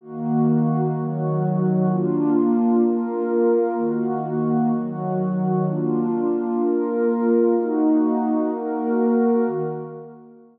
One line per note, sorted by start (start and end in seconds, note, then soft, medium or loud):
0.01 0.94 D#3 medium
0.01 0.94 A#3 loud
0.01 0.94 F#4 loud
0.95 1.88 D#3 loud
0.95 1.88 F#3 loud
0.95 1.88 F#4 medium
1.89 2.83 A#3 loud
1.89 2.83 D4 loud
1.89 2.83 F4 loud
2.83 3.77 A#3 loud
2.83 3.77 F4 medium
2.83 3.77 A#4 loud
3.78 4.71 D#3 loud
3.78 4.72 A#3 medium
3.78 4.71 F#4 loud
4.72 5.66 D#3 medium
4.72 5.66 F#3 medium
4.72 5.66 F#4 loud
5.67 6.60 A#3 medium
5.67 6.60 D4 medium
5.67 6.60 F4 medium
6.61 7.54 A#3 loud
6.61 7.54 F4 medium
6.61 7.54 A#4 loud
7.56 8.50 A#3 medium
7.56 8.50 D#4 loud
7.56 8.50 F#4 medium
8.52 9.45 A#3 medium
8.52 9.45 F#4 medium
8.52 9.45 A#4 loud
9.46 9.62 D#3 medium
9.46 9.62 A#3 loud
9.46 9.62 F#4 loud